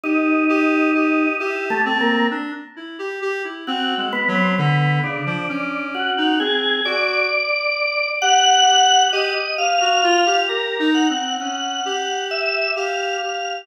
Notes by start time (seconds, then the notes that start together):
0.03 D#4 G4
0.49 G4
0.94 G4
1.40 E4 G4
1.70 A3
1.85 C4
2.00 A#3
2.31 D4
2.76 E4
2.99 G4
3.22 G4
3.44 E4
3.67 C4 F#4
3.97 G#3
4.13 B3
4.28 F#3
4.35 C4
4.58 D3 B3
5.03 C#3 D4
5.26 F3
5.49 C#4
5.94 F#4
6.17 D#4
6.40 C4 G#4
6.85 F#4 D5
8.22 G4 F#5
8.67 G4
9.13 G4 D#5
9.35 G4
9.58 G4 F5
9.81 F#4
10.03 F4
10.26 G4
10.49 G4 A#4
10.79 D#4
10.94 F#5
11.09 C4
11.40 C#4 F#5
11.85 G4
12.31 E5
12.76 G4 F5
13.22 G4